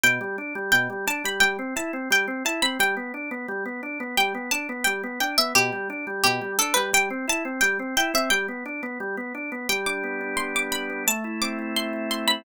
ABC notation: X:1
M:2/2
L:1/8
Q:1/2=87
K:G
V:1 name="Harpsichord"
g4 g2 a b | g2 a2 g2 a b | g4 z4 | g2 a2 g2 g e |
G4 G2 A B | g2 a2 g2 g e | g7 z | g d' z2 c' d' b2 |
a2 d'2 c'2 c' b |]
V:2 name="Drawbar Organ"
B,, G, D G, B,, G, D G, | G, C E C G, C E C | G, B, D B, G, B, D B, | G, B, D B, G, B, D B, |
B,, G, D G, B,, G, D G, | G, C E C G, C E C | G, B, D B, G, B, D B, | G, D B, D G, D D B, |
A, E C E A, E E C |]